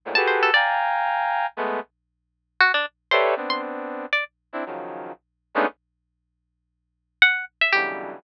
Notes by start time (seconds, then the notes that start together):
0.05 G#2 A2 A#2
0.15 F#4 G4 G#4 A4 B4 A5
0.27 C5
0.43 A4
0.54 D5 F5 G5 G#5 A#5
1.57 G#3 A3 B3
2.60 F#4
2.74 D4
3.11 G4 A4 B4 C5 C#5 D5 E5
3.36 B3 C4 D4
3.50 C6
4.13 D5
4.53 C4 D4 E4
4.66 C#3 D#3 F3 F#3
5.55 G#3 A3 B3 C#4 D4 D#4
7.22 F#5
7.61 E5
7.73 B2 C#3 D3 E3 F#3 G3 G4